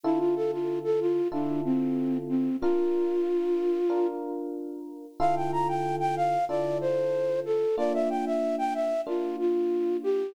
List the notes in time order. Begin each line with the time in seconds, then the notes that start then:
0.03 D3 E4 F4 A4
0.19 F4
0.36 A4
0.52 F4
0.84 A4
1.00 F4
1.32 D3 D4 E4 F4 A4
1.65 C4
2.29 C4
2.61 D4 F4 A#4
3.90 D4 F4 A#4
5.20 D3 E4 F4 A4 F5
5.36 G5
5.52 A#5
5.68 G5
6.00 G5
6.16 F5
6.49 D3 E4 F4 A4 D5
6.81 C5
7.45 A4
7.77 A#3 D4 F4 D5
7.94 E5
8.10 G5
8.26 E5
8.58 G5
8.74 E5
9.07 A#3 D4 F4
9.39 F4
10.03 G4